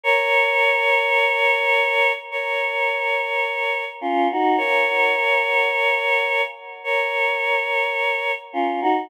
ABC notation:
X:1
M:4/4
L:1/16
Q:1/4=53
K:Db
V:1 name="Choir Aahs"
[Bd]8 [Bd]6 [DF] [EG] | [Bd]8 [Bd]6 [DF] [EG] |]